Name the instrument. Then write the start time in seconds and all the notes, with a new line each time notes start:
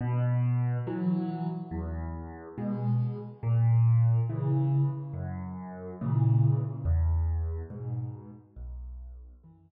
acoustic grand piano
0.01 B2
0.87 E3 F#3
1.71 E2
2.58 B2 G#3
3.43 A#2
4.29 C#3 E3
5.13 F#2
6.01 A#2 C#3 E3
6.85 E2
7.70 G#2 B2
8.56 B1
9.43 F#2 E3